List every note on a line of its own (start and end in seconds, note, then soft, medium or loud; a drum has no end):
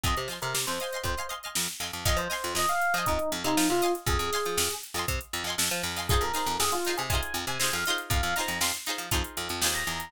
0.03 0.15 F2 medium
0.03 0.24 D#5 loud
0.03 0.16 D#5 medium
0.03 0.24 F5 medium
0.03 0.24 G#5 medium
0.03 0.24 C6 medium
0.03 kick medium
0.03 closed hi-hat medium
0.17 0.29 C3 medium
0.17 closed hi-hat medium
0.28 0.39 F3 soft
0.28 0.70 D#5 medium
0.28 0.70 F5 medium
0.28 snare soft
0.28 closed hi-hat medium
0.32 0.70 G#5 medium
0.32 0.70 C6 medium
0.42 0.54 C3 medium
0.42 0.54 A#4 medium
0.42 closed hi-hat medium
0.54 0.66 C3 medium
0.54 snare medium
0.67 0.79 F2 medium
0.67 0.99 C5 medium
0.67 closed hi-hat medium
0.80 0.90 D#5 medium
0.80 0.90 F5 medium
0.80 0.90 G#5 medium
0.80 0.90 C6 medium
0.80 closed hi-hat medium
0.93 1.13 D#5 medium
0.93 1.13 F5 medium
0.93 1.13 G#5 medium
0.93 1.13 C6 medium
0.93 closed hi-hat medium
1.03 1.15 F2 medium
1.03 1.27 C5 medium
1.03 kick medium
1.03 closed hi-hat medium
1.17 1.27 D#5 medium
1.17 1.27 F5 medium
1.17 1.27 G#5 medium
1.17 1.27 C6 medium
1.17 closed hi-hat medium
1.29 1.39 D#5 medium
1.29 1.39 F5 medium
1.29 1.39 G#5 medium
1.29 1.39 C6 medium
1.29 closed hi-hat medium
1.43 1.74 D#5 medium
1.43 1.74 F5 medium
1.43 1.74 G#5 medium
1.43 closed hi-hat soft
1.47 1.74 C6 medium
1.55 1.68 F2 medium
1.55 snare loud
1.68 closed hi-hat medium
1.80 1.91 F2 medium
1.80 2.00 D#5 medium
1.80 2.00 F5 medium
1.80 2.00 G#5 medium
1.80 2.00 C6 medium
1.80 snare soft
1.80 closed hi-hat medium
1.93 2.05 F2 medium
1.93 closed hi-hat medium
2.05 2.17 F2 medium
2.05 2.26 D#5 loud
2.05 2.18 D#5 medium
2.05 2.26 F5 loud
2.05 2.26 G#5 loud
2.05 2.26 C6 loud
2.05 kick medium
2.05 closed hi-hat medium
2.17 2.28 F3 medium
2.17 2.53 C5 medium
2.17 closed hi-hat medium
2.30 2.70 D#5 medium
2.30 2.70 F5 medium
2.30 2.70 G#5 medium
2.30 2.70 C6 medium
2.30 snare medium
2.30 closed hi-hat medium
2.44 2.54 F2 medium
2.44 closed hi-hat medium
2.55 2.66 F2 medium
2.55 2.68 D#5 medium
2.55 snare medium
2.69 2.94 F5 medium
2.69 closed hi-hat medium
2.82 closed hi-hat medium
2.94 3.05 F3 medium
2.94 3.06 D#5 medium
2.94 3.36 D#5 medium
2.94 3.36 F5 medium
2.94 closed hi-hat medium
2.98 3.36 G#5 loud
2.98 3.36 C6 medium
3.06 3.19 F2 medium
3.06 3.29 D#4 medium
3.06 kick medium
3.06 closed hi-hat medium
3.19 closed hi-hat medium
3.32 3.43 F2 medium
3.32 closed hi-hat medium
3.44 3.56 C3 medium
3.44 3.65 D#4 medium
3.44 3.80 D#5 medium
3.44 3.80 F5 medium
3.44 3.80 G#5 medium
3.44 3.80 C6 medium
3.44 closed hi-hat medium
3.57 3.68 F3 medium
3.57 snare loud
3.69 3.81 C3 medium
3.69 3.92 F4 medium
3.69 closed hi-hat medium
3.82 4.28 D#5 loud
3.82 4.28 F5 loud
3.82 4.28 G#5 loud
3.82 4.28 C6 medium
3.82 closed hi-hat medium
3.95 closed hi-hat medium
4.06 4.18 F2 medium
4.06 4.72 G#4 medium
4.06 kick medium
4.06 closed hi-hat medium
4.19 4.30 F2 medium
4.19 closed hi-hat medium
4.32 4.73 D#5 loud
4.32 4.73 F5 medium
4.32 4.73 G#5 medium
4.32 4.73 C6 medium
4.32 snare medium
4.32 closed hi-hat medium
4.45 4.57 F3 medium
4.45 closed hi-hat medium
4.57 4.69 F2 medium
4.57 snare loud
4.71 closed hi-hat medium
4.83 closed hi-hat medium
4.94 5.06 F2 medium
4.94 5.36 D#5 medium
4.94 5.36 F5 medium
4.94 5.36 G#5 medium
4.94 snare soft
4.94 closed hi-hat medium
4.99 5.36 C6 medium
5.08 5.19 C3 medium
5.08 kick medium
5.08 closed hi-hat loud
5.21 closed hi-hat medium
5.33 5.44 F2 medium
5.33 closed hi-hat medium
5.44 5.55 F2 medium
5.44 5.87 D#5 medium
5.44 5.87 F5 medium
5.49 5.87 G#5 medium
5.49 5.87 C6 medium
5.58 5.69 F2 medium
5.58 snare loud
5.71 5.83 F3 medium
5.71 closed hi-hat medium
5.83 6.20 F2 medium
5.83 snare soft
5.83 closed hi-hat medium
5.96 6.06 D#5 medium
5.96 6.06 F5 medium
5.96 6.06 G#5 medium
5.96 6.06 C6 medium
5.96 snare soft
5.96 closed hi-hat medium
6.09 6.30 D#4 loud
6.09 6.30 F4 loud
6.09 6.21 G#4 medium
6.09 6.30 G#4 loud
6.09 kick loud
6.09 closed hi-hat medium
6.13 6.30 C5 loud
6.21 6.32 F2 medium
6.21 6.54 A#4 medium
6.21 closed hi-hat medium
6.33 6.74 D#4 medium
6.33 6.74 F4 medium
6.33 6.74 G#4 medium
6.33 6.74 C5 medium
6.33 snare medium
6.33 closed hi-hat medium
6.46 6.58 F2 medium
6.46 closed hi-hat medium
6.59 6.71 F2 medium
6.59 6.71 G#4 medium
6.59 snare loud
6.72 6.93 F4 medium
6.72 snare soft
6.72 closed hi-hat medium
6.85 7.07 D#4 medium
6.85 7.07 F4 loud
6.85 7.07 G#4 medium
6.85 snare soft
6.85 closed hi-hat medium
6.90 7.07 C5 medium
6.97 7.09 C3 medium
6.97 7.09 G#4 medium
6.97 closed hi-hat medium
7.10 7.21 C3 medium
7.10 7.52 D#4 medium
7.10 7.52 F4 medium
7.10 7.52 G#4 medium
7.10 7.33 G#5 medium
7.10 kick medium
7.10 closed hi-hat loud
7.15 7.52 C5 medium
7.22 closed hi-hat medium
7.34 7.45 F2 medium
7.34 closed hi-hat medium
7.47 7.58 C3 medium
7.47 7.72 G#5 medium
7.47 closed hi-hat medium
7.59 7.71 C3 medium
7.59 7.85 D#4 medium
7.59 7.85 F4 medium
7.59 7.85 G#4 medium
7.59 snare medium
7.64 7.85 C5 medium
7.73 7.84 F2 medium
7.73 7.97 F5 medium
7.73 closed hi-hat medium
7.86 8.32 D#4 loud
7.86 8.32 F4 loud
7.86 8.32 G#4 medium
7.86 closed hi-hat medium
7.90 8.32 C5 loud
7.98 closed hi-hat medium
8.10 8.21 F2 medium
8.10 8.34 F5 medium
8.10 kick loud
8.10 closed hi-hat medium
8.23 8.34 F2 medium
8.23 closed hi-hat medium
8.36 8.77 D#4 medium
8.36 8.77 F4 medium
8.36 8.77 G#4 medium
8.36 8.57 A#5 medium
8.36 snare medium
8.36 closed hi-hat medium
8.40 8.77 C5 medium
8.48 8.59 F2 medium
8.48 closed hi-hat medium
8.61 8.72 F2 medium
8.61 8.73 C6 medium
8.61 snare loud
8.74 closed hi-hat medium
8.86 9.07 D#4 medium
8.86 9.07 F4 medium
8.86 9.07 G#4 medium
8.86 9.07 C5 medium
8.86 closed hi-hat medium
8.98 9.10 F3 medium
8.98 closed hi-hat medium
9.11 9.23 F2 medium
9.11 9.51 D#4 medium
9.11 9.51 F4 loud
9.11 9.51 G#4 medium
9.11 9.51 C5 medium
9.11 kick medium
9.11 closed hi-hat loud
9.24 closed hi-hat medium
9.37 9.49 F2 medium
9.37 closed hi-hat medium
9.49 9.61 F2 medium
9.49 closed hi-hat medium
9.61 9.84 D#2 medium
9.61 10.03 D#4 medium
9.61 10.03 F4 medium
9.61 10.03 G#4 loud
9.61 snare loud
9.66 10.03 C5 medium
9.75 10.10 A#5 medium
9.75 closed hi-hat medium
9.87 10.10 E2 medium
9.87 closed hi-hat medium
10.00 closed hi-hat medium